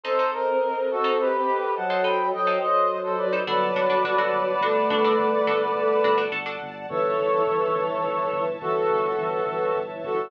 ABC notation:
X:1
M:12/8
L:1/16
Q:3/8=70
K:Glyd
V:1 name="Brass Section"
[A=c]2 _B4 [FA]2 [G=B]4 [fa]2 [gb]2 [_eg]2 [ce]3 [Ac] [Bd]2 | [Bd]20 z4 | [Ac]12 [FA]10 [FA]2 |]
V:2 name="Choir Aahs"
=C12 F,4 F,2 F,6 | F,8 A,12 z4 | E,12 E,4 E,2 E,6 |]
V:3 name="Pizzicato Strings"
[_EA=c] [EAc]6 [EAc]6 [EAc] [EAc]3 [EAc]6 [EAc] | [DFA]2 [DFA] [DFA] [DFA] [DFA]3 [DFA]2 [DFA] [DFA]3 [DFA]4 [DFA] [DFA] [DFA] [DFA]3 | z24 |]
V:4 name="Synth Bass 2" clef=bass
z24 | G,,,2 G,,,2 G,,,2 G,,,2 G,,,2 G,,,2 G,,,2 G,,,2 G,,,2 G,,,2 G,,,2 G,,,2 | G,,,2 G,,,2 G,,,2 G,,,2 G,,,2 G,,,2 G,,,2 G,,,2 G,,,2 G,,,2 G,,,2 G,,,2 |]
V:5 name="String Ensemble 1"
[A=c_e]24 | [dfa]24 | [cea]24 |]